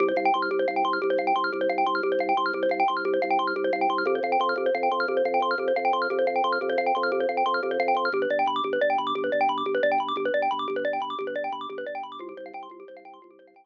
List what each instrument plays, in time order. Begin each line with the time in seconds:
0.00 drawbar organ C2, xylophone G4
0.08 xylophone C5
0.16 drawbar organ C2, xylophone F5
0.25 xylophone G5
0.34 drawbar organ C2, xylophone C6
0.42 xylophone F6
0.51 drawbar organ C2, xylophone G4
0.59 xylophone C5
0.68 drawbar organ C2, xylophone F5
0.76 xylophone G5
0.85 drawbar organ C2, xylophone C6
0.93 xylophone F6
1.02 drawbar organ C2, xylophone G4
1.10 xylophone C5
1.18 drawbar organ C2, xylophone F5
1.27 xylophone G5
1.36 drawbar organ C2, xylophone C6
1.44 xylophone F6
1.53 drawbar organ C2, xylophone G4
1.61 xylophone C5
1.69 drawbar organ C2, xylophone F5
1.78 xylophone G5
1.86 drawbar organ C2, xylophone C6
1.95 xylophone F6
2.03 drawbar organ C2, xylophone G4
2.12 xylophone C5
2.19 drawbar organ C2, xylophone F5
2.29 xylophone G5
2.37 drawbar organ C2, xylophone C6
2.46 xylophone F6
2.53 drawbar organ C2, xylophone G4
2.63 xylophone C5
2.69 drawbar organ C2, xylophone F5
2.80 xylophone G5
2.88 drawbar organ C2, xylophone C6
2.97 xylophone F6
3.05 drawbar organ C2, xylophone G4
3.14 xylophone C5
3.22 drawbar organ C2, xylophone F5
3.31 xylophone G5
3.39 drawbar organ C2, xylophone C6
3.47 xylophone F6
3.56 drawbar organ C2, xylophone G4
3.64 xylophone C5
3.73 drawbar organ C2, xylophone F5
3.81 xylophone G5
3.89 drawbar organ C2, xylophone C6
3.98 xylophone F6
4.06 drawbar organ F2, xylophone G4
4.15 xylophone C5
4.23 drawbar organ F2, xylophone F5
4.32 xylophone G5
4.40 drawbar organ F2, xylophone C6
4.49 xylophone F6
4.56 drawbar organ F2, xylophone G4
4.66 xylophone C5
4.75 drawbar organ F2, xylophone F5
4.83 xylophone G5
4.92 drawbar organ F2, xylophone C6
5.00 xylophone F6
5.08 drawbar organ F2, xylophone G4
5.17 xylophone C5
5.25 drawbar organ F2, xylophone F5
5.34 xylophone G5
5.40 drawbar organ F2, xylophone C6
5.51 xylophone F6
5.58 drawbar organ F2, xylophone G4
5.68 xylophone C5
5.76 drawbar organ F2, xylophone F5
5.85 xylophone G5
5.93 drawbar organ F2, xylophone C6
6.02 xylophone F6
6.10 drawbar organ F2, xylophone G4
6.19 xylophone C5
6.27 drawbar organ F2, xylophone F5
6.36 xylophone G5
6.44 drawbar organ F2, xylophone C6
6.52 xylophone F6
6.61 drawbar organ F2, xylophone G4
6.69 xylophone C5
6.78 drawbar organ F2, xylophone F5
6.86 xylophone G5
6.95 drawbar organ F2, xylophone C6
7.03 xylophone F6
7.12 drawbar organ F2, xylophone G4
7.20 xylophone C5
7.29 drawbar organ F2, xylophone F5
7.37 xylophone G5
7.46 drawbar organ F2, xylophone C6
7.54 xylophone F6
7.63 drawbar organ F2, xylophone G4
7.71 xylophone C5
7.80 drawbar organ F2, xylophone F5
7.88 xylophone G5
7.95 drawbar organ F2, xylophone C6
8.05 xylophone F6
8.12 drawbar organ G1, xylophone G4
8.22 xylophone B4
8.30 drawbar organ G1, xylophone D5
8.39 xylophone G5
8.46 drawbar organ G1, xylophone B5
8.56 xylophone D6
8.64 drawbar organ G1, xylophone G4
8.73 xylophone B4
8.81 drawbar organ G1, xylophone D5
8.90 xylophone G5
8.98 drawbar organ G1, xylophone B5
9.07 xylophone D6
9.15 drawbar organ G1, xylophone G4
9.24 xylophone B4
9.32 drawbar organ G1, xylophone D5
9.41 xylophone G5
9.49 drawbar organ G1, xylophone B5
9.58 xylophone D6
9.65 drawbar organ G1, xylophone G4
9.75 xylophone B4
9.83 drawbar organ G1, xylophone D5
9.92 xylophone G5
9.98 drawbar organ G1, xylophone B5
10.08 xylophone D6
10.16 drawbar organ G1, xylophone G4
10.25 xylophone B4
10.34 drawbar organ G1, xylophone D5
10.42 xylophone G5
10.51 drawbar organ G1, xylophone B5
10.59 xylophone D6
10.68 drawbar organ G1, xylophone G4
10.76 xylophone B4
10.85 drawbar organ G1, xylophone D5
10.93 xylophone G5
11.00 drawbar organ G1, xylophone B5
11.10 xylophone D6
11.19 drawbar organ G1, xylophone G4
11.27 xylophone B4
11.35 drawbar organ G1, xylophone D5
11.44 xylophone G5
11.52 drawbar organ G1, xylophone B5
11.61 xylophone D6
11.69 drawbar organ G1, xylophone G4
11.78 xylophone B4
11.86 drawbar organ G1, xylophone D5
11.95 xylophone G5
12.03 drawbar organ G1, xylophone B5
12.12 xylophone D6
12.19 drawbar organ C2, xylophone F4
12.29 xylophone G4
12.37 drawbar organ C2, xylophone C5
12.46 xylophone F5
12.54 drawbar organ C2, xylophone G5
12.63 xylophone C6
12.70 drawbar organ C2, xylophone F4
12.80 xylophone G4
12.88 drawbar organ C2, xylophone C5
12.97 xylophone F5
13.05 drawbar organ C2, xylophone G5
13.14 xylophone C6
13.22 drawbar organ C2, xylophone F4
13.31 xylophone G4
13.39 drawbar organ C2, xylophone C5
13.47 xylophone F5
13.54 drawbar organ C2, xylophone G5
13.64 xylophone C6